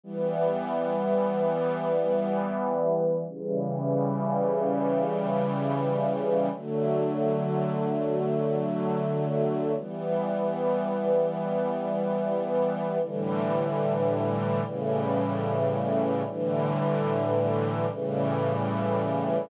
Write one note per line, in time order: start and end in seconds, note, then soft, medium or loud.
0.04 3.25 E3 medium
0.04 3.25 G3 loud
0.04 3.25 B3 loud
3.28 6.49 C#3 loud
3.28 6.49 E3 medium
3.28 6.49 G3 loud
6.52 9.73 D3 medium
6.52 9.73 F#3 medium
6.52 9.73 A3 medium
9.77 12.98 E3 medium
9.77 12.98 G3 medium
9.77 12.98 B3 medium
13.01 14.62 A2 medium
13.01 14.62 D3 medium
13.01 14.62 E3 medium
13.01 14.62 G3 loud
14.63 16.23 A2 loud
14.63 16.23 C#3 medium
14.63 16.23 E3 medium
14.63 16.23 G3 medium
16.26 17.86 A2 loud
16.26 17.86 D3 loud
16.26 17.86 E3 medium
16.26 17.86 G3 medium
17.88 19.48 A2 loud
17.88 19.48 C#3 medium
17.88 19.48 E3 medium
17.88 19.48 G3 loud